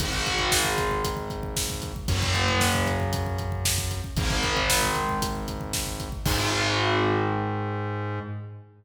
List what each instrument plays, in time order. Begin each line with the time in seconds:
0.00 synth bass 1 G#1, overdriven guitar D#3 G#3, kick, closed hi-hat
0.13 kick
0.26 kick, closed hi-hat
0.39 kick
0.52 kick, snare
0.65 kick
0.78 kick, closed hi-hat
0.91 kick
1.04 kick, closed hi-hat
1.17 kick
1.30 kick, closed hi-hat
1.43 kick
1.56 kick, snare
1.70 kick
1.82 kick, closed hi-hat
1.96 kick
2.08 synth bass 1 F#2, overdriven guitar C#3 F#3, kick, closed hi-hat
2.22 kick
2.34 kick, closed hi-hat
2.48 kick
2.61 kick, snare
2.75 kick
2.87 kick, closed hi-hat
3.00 kick
3.13 kick, closed hi-hat
3.26 kick
3.38 kick, closed hi-hat
3.52 kick
3.65 kick, snare
3.78 kick
3.91 kick, closed hi-hat
4.04 kick
4.16 synth bass 1 G#1, overdriven guitar D#3 G#3, kick, closed hi-hat
4.30 kick
4.43 kick, closed hi-hat
4.57 kick
4.70 kick, snare
4.82 kick
4.95 kick, closed hi-hat
5.09 kick
5.22 kick, closed hi-hat
5.35 kick
5.48 kick, closed hi-hat
5.61 kick
5.73 kick, snare
5.87 kick
6.00 kick, closed hi-hat
6.12 kick
6.26 synth bass 1 G#2, overdriven guitar D#3 G#3, kick, crash